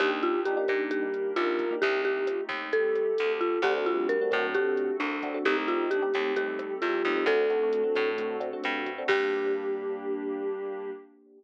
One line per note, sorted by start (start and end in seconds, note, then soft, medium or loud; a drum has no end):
0.00 0.58 D#2 loud
0.00 0.36 A#3 loud
0.00 0.90 A#3 medium
0.00 0.36 D4 loud
0.00 0.90 D4 medium
0.00 0.36 D#4 loud
0.00 0.90 D#4 loud
0.00 0.11 G4 loud
0.00 0.36 G4 loud
0.00 0.41 G4 loud
0.00 0.90 G4 medium
0.00 kick medium
0.00 cross-stick medium
0.00 closed hi-hat medium
0.23 0.42 F4 medium
0.23 closed hi-hat medium
0.45 0.55 A#3 medium
0.45 0.55 D4 loud
0.45 0.55 D#4 medium
0.45 0.56 F4 medium
0.45 0.83 G4 medium
0.45 0.55 G4 medium
0.45 closed hi-hat medium
0.57 0.66 A#3 loud
0.57 0.66 D4 loud
0.57 0.66 D#4 medium
0.57 0.66 G4 loud
0.68 1.27 A#2 medium
0.68 1.05 A#3 medium
0.68 1.05 D4 loud
0.68 1.05 D#4 loud
0.68 1.05 G4 loud
0.68 kick medium
0.68 cross-stick medium
0.68 closed hi-hat medium
0.91 1.32 G3 medium
0.91 1.80 A#3 medium
0.91 1.80 D4 medium
0.91 1.80 G4 medium
0.91 1.34 G4 medium
0.91 1.80 A#4 medium
0.91 kick medium
0.91 closed hi-hat medium
1.14 closed hi-hat medium
1.36 1.75 C2 medium
1.36 1.63 A#3 loud
1.36 1.77 A#3 medium
1.36 1.63 D4 medium
1.36 1.63 D#4 loud
1.36 1.75 F4 medium
1.36 1.63 G4 medium
1.36 cross-stick medium
1.36 closed hi-hat medium
1.59 kick medium
1.59 closed hi-hat medium
1.71 1.80 A#3 loud
1.71 1.80 D4 medium
1.71 1.80 D#4 loud
1.71 1.80 G4 loud
1.82 2.41 C2 loud
1.82 2.72 A3 medium
1.82 2.72 C4 medium
1.82 2.72 D#4 medium
1.82 2.02 G4 loud
1.82 2.19 G4 loud
1.82 2.72 G4 medium
1.82 kick medium
1.82 closed hi-hat medium
2.05 2.44 G4 medium
2.05 closed hi-hat medium
2.27 2.38 F4 medium
2.27 cross-stick medium
2.27 closed hi-hat medium
2.49 3.07 D#2 medium
2.49 kick medium
2.49 closed hi-hat medium
2.73 3.12 G3 medium
2.73 3.63 A3 medium
2.73 3.63 C4 medium
2.73 3.63 G4 medium
2.73 3.32 A4 medium
2.73 3.63 A4 medium
2.73 kick medium
2.73 closed hi-hat medium
2.95 cross-stick medium
2.95 closed hi-hat medium
3.18 3.59 D2 medium
3.18 3.59 A3 medium
3.18 closed hi-hat medium
3.41 3.61 F4 medium
3.41 kick medium
3.41 closed hi-hat medium
3.62 4.20 D2 loud
3.62 3.85 A3 loud
3.62 3.73 A3 loud
3.62 4.54 A3 medium
3.62 3.73 C4 loud
3.62 4.54 C4 medium
3.62 3.73 D4 loud
3.62 4.54 D4 medium
3.62 3.73 F#4 loud
3.62 4.54 F#4 medium
3.62 3.74 G4 medium
3.62 kick medium
3.62 cross-stick medium
3.62 closed hi-hat medium
3.77 3.86 A3 loud
3.77 3.86 C4 loud
3.77 3.86 D4 loud
3.77 3.86 F#4 medium
3.86 4.28 G3 loud
3.86 4.15 A3 medium
3.86 4.15 C4 loud
3.86 4.15 D4 medium
3.86 4.07 F4 medium
3.86 4.15 F#4 medium
3.86 closed hi-hat medium
4.09 4.46 A#4 medium
4.09 closed hi-hat medium
4.21 4.30 A3 medium
4.21 4.30 C4 medium
4.21 4.30 D4 medium
4.21 4.30 F#4 loud
4.31 4.91 A2 loud
4.31 4.53 F#3 medium
4.31 4.49 A3 medium
4.31 4.49 C4 medium
4.31 4.49 D4 medium
4.31 4.49 F#4 medium
4.31 kick medium
4.31 cross-stick medium
4.31 closed hi-hat medium
4.54 5.44 A3 medium
4.54 4.75 A3 medium
4.54 4.92 A3 medium
4.54 5.44 C4 medium
4.54 4.92 C4 loud
4.54 4.92 D4 loud
4.54 5.44 F#4 medium
4.54 4.92 F#4 loud
4.54 4.97 G4 medium
4.54 5.44 A4 medium
4.54 kick medium
4.54 closed hi-hat medium
4.77 closed hi-hat medium
5.00 5.38 C2 medium
5.00 5.44 D4 medium
5.00 cross-stick medium
5.00 closed hi-hat medium
5.23 5.32 A3 medium
5.23 5.32 C4 medium
5.23 5.32 D4 medium
5.23 5.32 F#4 medium
5.23 kick medium
5.23 closed hi-hat medium
5.34 5.43 A3 loud
5.34 5.43 C4 medium
5.34 5.43 D4 loud
5.34 5.43 F#4 loud
5.45 6.03 C2 loud
5.45 6.35 A3 medium
5.45 5.55 A3 loud
5.45 6.35 C4 medium
5.45 5.55 C4 loud
5.45 6.35 D#4 medium
5.45 5.55 D#4 loud
5.45 5.85 D#4 loud
5.45 6.35 G4 medium
5.45 5.55 G4 loud
5.45 5.56 G4 loud
5.45 kick medium
5.45 closed hi-hat medium
5.57 5.66 A3 medium
5.57 5.66 C4 medium
5.57 5.66 D#4 medium
5.57 5.66 G4 medium
5.68 5.96 A3 medium
5.68 5.96 C4 loud
5.68 5.96 D#4 medium
5.68 5.89 F4 medium
5.68 5.96 G4 medium
5.68 closed hi-hat medium
5.91 6.02 D4 medium
5.91 6.34 G4 medium
5.91 cross-stick medium
5.91 closed hi-hat medium
6.02 6.11 A3 medium
6.02 6.11 C4 medium
6.02 6.11 D#4 medium
6.02 6.11 G4 loud
6.14 6.73 D#2 medium
6.14 6.32 A3 loud
6.14 6.32 C4 loud
6.14 6.32 D#4 medium
6.14 6.32 G4 medium
6.14 kick medium
6.14 closed hi-hat medium
6.36 6.77 G3 medium
6.36 7.26 A3 medium
6.36 6.73 A3 medium
6.36 7.26 C4 medium
6.36 6.73 C4 medium
6.36 6.73 D#4 medium
6.36 7.26 G4 medium
6.36 6.73 G4 medium
6.36 6.74 G4 medium
6.36 7.26 A4 medium
6.36 kick medium
6.36 closed hi-hat medium
6.59 cross-stick medium
6.59 closed hi-hat medium
6.82 7.03 E2 medium
6.82 7.24 G3 loud
6.82 7.25 F4 medium
6.82 closed hi-hat medium
7.05 7.25 D#2 medium
7.05 7.15 A3 loud
7.05 7.15 C4 medium
7.05 7.15 D#4 loud
7.05 7.15 G4 medium
7.05 kick medium
7.05 closed hi-hat medium
7.16 7.25 A3 medium
7.16 7.25 C4 loud
7.16 7.25 D#4 loud
7.16 7.25 G4 loud
7.26 7.84 D2 loud
7.26 8.37 A3 loud
7.26 7.46 A3 loud
7.26 8.17 A3 medium
7.26 7.46 C4 loud
7.26 8.17 C4 medium
7.26 7.46 D4 loud
7.26 8.17 D4 medium
7.26 7.46 F#4 loud
7.26 8.17 F#4 medium
7.26 8.09 A4 loud
7.26 kick medium
7.26 cross-stick medium
7.26 closed hi-hat medium
7.50 7.59 A3 medium
7.50 7.59 C4 medium
7.50 7.59 D4 medium
7.50 7.59 F#4 loud
7.50 closed hi-hat medium
7.63 7.81 A3 loud
7.63 7.81 C4 medium
7.63 7.81 D4 medium
7.63 7.81 F#4 medium
7.73 closed hi-hat medium
7.84 8.11 A3 medium
7.84 8.11 C4 loud
7.84 8.11 D4 medium
7.84 8.11 F#4 loud
7.95 8.54 A2 medium
7.95 kick medium
7.95 cross-stick medium
7.95 closed hi-hat medium
8.18 9.08 A3 medium
8.18 8.36 A3 loud
8.18 9.08 C4 medium
8.18 8.36 C4 loud
8.18 8.36 D4 loud
8.18 9.08 F#4 medium
8.18 8.36 F#4 medium
8.18 9.08 A4 medium
8.18 kick medium
8.18 closed hi-hat medium
8.40 8.49 A3 loud
8.40 8.49 C4 loud
8.40 8.49 D4 loud
8.40 8.49 F#4 medium
8.40 closed hi-hat medium
8.53 8.89 A3 medium
8.53 8.89 C4 medium
8.53 8.89 D4 medium
8.53 8.89 F#4 medium
8.64 9.03 G2 medium
8.64 cross-stick medium
8.64 closed hi-hat medium
8.86 kick medium
8.86 closed hi-hat medium
8.98 9.07 A3 medium
8.98 9.07 C4 loud
8.98 9.07 D4 medium
8.98 9.07 F#4 medium
9.08 10.90 G2 loud
9.08 10.91 G3 loud
9.08 10.91 A#3 loud
9.08 10.92 A#3 medium
9.08 10.91 D4 loud
9.08 10.92 D4 medium
9.08 10.90 G4 loud
9.08 10.91 G4 loud
9.08 10.92 G4 loud
9.08 kick loud
9.08 crash loud